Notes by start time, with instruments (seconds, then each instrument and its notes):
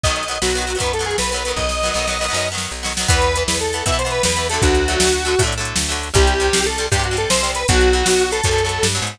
0.04 electric bass (finger) B1, acoustic guitar (steel) D#3 F#3 B3, lead 1 (square) D#5, kick, closed hi-hat
0.09 closed hi-hat
0.16 lead 1 (square) D#5, closed hi-hat
0.23 closed hi-hat
0.28 acoustic guitar (steel) D#3 F#3 B3, lead 1 (square) D#5, closed hi-hat
0.35 closed hi-hat
0.42 electric bass (finger) B1, acoustic guitar (steel) D#3 F#3 B3, lead 1 (square) F#4, snare
0.50 closed hi-hat
0.55 acoustic guitar (steel) D#3 F#3 B3, closed hi-hat
0.62 closed hi-hat
0.67 acoustic guitar (steel) D#3 F#3 B3, closed hi-hat
0.75 acoustic guitar (steel) D#3 F#3 B3, closed hi-hat
0.80 electric bass (finger) F#2, acoustic guitar (steel) D#3 F#3 B3, lead 1 (square) B4, kick, closed hi-hat
0.86 closed hi-hat
0.93 lead 1 (square) A4, closed hi-hat
0.99 acoustic guitar (steel) D#3 F#3 B3, closed hi-hat
1.05 lead 1 (square) G#4, closed hi-hat
1.11 closed hi-hat
1.18 electric bass (finger) B1, lead 1 (square) B4, snare
1.23 closed hi-hat
1.31 acoustic guitar (steel) F#3 B3, lead 1 (square) B4, closed hi-hat
1.36 acoustic guitar (steel) D#3, closed hi-hat
1.45 acoustic guitar (steel) D#3 F#3 B3, closed hi-hat
1.50 closed hi-hat
1.56 electric bass (finger) B1, lead 1 (square) D#5, kick
1.69 snare
1.83 acoustic guitar (steel) D#3 F#3 B3, snare
1.94 electric bass (finger) B1, acoustic guitar (steel) F#3 B3, snare
1.98 acoustic guitar (steel) D#3
2.07 acoustic guitar (steel) D#3 F#3 B3, snare
2.21 acoustic guitar (steel) D#3 F#3 B3, snare
2.28 acoustic guitar (steel) D#3 F#3 B3
2.33 electric bass (finger) F#2, acoustic guitar (steel) D#3 F#3 B3, snare
2.52 acoustic guitar (steel) D#3 F#3 B3
2.58 snare
2.71 electric bass (finger) B1
2.83 acoustic guitar (steel) D#3 F#3 B3, snare
2.97 acoustic guitar (steel) D#3 F#3 B3, snare
3.08 electric bass (finger) E2, acoustic guitar (steel) E3 B3, lead 1 (square) B4, kick, closed hi-hat
3.22 closed hi-hat
3.36 acoustic guitar (steel) E3 B3, closed hi-hat
3.47 electric bass (finger) E2, lead 1 (square) B4, snare
3.61 lead 1 (square) A4, closed hi-hat
3.73 acoustic guitar (steel) E3 B3, closed hi-hat
3.86 electric bass (finger) B2, acoustic guitar (steel) E3 B3, lead 1 (square) E5, kick, closed hi-hat
3.92 acoustic guitar (steel) E3 B3
3.99 lead 1 (square) C5, closed hi-hat
4.05 acoustic guitar (steel) E3 B3
4.11 lead 1 (square) B4, closed hi-hat
4.23 electric bass (finger) E2, lead 1 (square) B4, snare
4.37 acoustic guitar (steel) E3 B3, closed hi-hat
4.49 acoustic guitar (steel) F#3 A3, lead 1 (square) A4, closed hi-hat
4.54 acoustic guitar (steel) D3
4.62 electric bass (finger) D2, lead 1 (square) F#4, kick, closed hi-hat
4.75 closed hi-hat
4.88 acoustic guitar (steel) D3 F#3 A3, closed hi-hat
5.00 electric bass (finger) D2, snare
5.13 closed hi-hat
5.25 acoustic guitar (steel) D3 F#3 A3, closed hi-hat
5.39 electric bass (finger) A2, acoustic guitar (steel) D3 F#3 A3, kick, closed hi-hat
5.44 acoustic guitar (steel) D3 F#3 A3
5.52 closed hi-hat
5.58 acoustic guitar (steel) D3 F#3 A3
5.65 closed hi-hat
5.76 electric bass (finger) D2, snare
5.89 acoustic guitar (steel) D3 F#3 A3, closed hi-hat
6.03 closed hi-hat
6.14 electric bass (finger) C2, acoustic guitar (steel) C3 G3, lead 1 (square) G4, kick, closed hi-hat
6.27 closed hi-hat
6.40 acoustic guitar (steel) C3 G3, closed hi-hat
6.53 electric bass (finger) C2, snare
6.66 lead 1 (square) A4, closed hi-hat
6.78 acoustic guitar (steel) C3 G3, closed hi-hat
6.92 electric bass (finger) G2, acoustic guitar (steel) C3 G3, lead 1 (square) G4, kick, closed hi-hat
6.98 acoustic guitar (steel) C3 G3
7.03 lead 1 (square) F#4, closed hi-hat
7.11 acoustic guitar (steel) C3 G3
7.17 lead 1 (square) A4, closed hi-hat
7.30 electric bass (finger) C2, lead 1 (square) C5, snare
7.43 acoustic guitar (steel) C3 G3, closed hi-hat
7.55 lead 1 (square) B4, closed hi-hat
7.68 electric bass (finger) B1, acoustic guitar (steel) B2 F#3, lead 1 (square) F#4, kick, closed hi-hat
7.81 closed hi-hat
7.93 acoustic guitar (steel) B2 F#3, closed hi-hat
8.06 electric bass (finger) B1, snare
8.20 closed hi-hat
8.31 acoustic guitar (steel) B2 F#3, lead 1 (square) A4, closed hi-hat
8.43 electric bass (finger) F#2, acoustic guitar (steel) B2 F#3, kick, closed hi-hat
8.51 acoustic guitar (steel) B2 F#3
8.58 closed hi-hat
8.65 acoustic guitar (steel) B2 F#3
8.69 closed hi-hat
8.83 electric bass (finger) G2, snare
8.95 acoustic guitar (steel) B2 F#3, closed hi-hat
9.02 electric bass (finger) G#2
9.07 closed hi-hat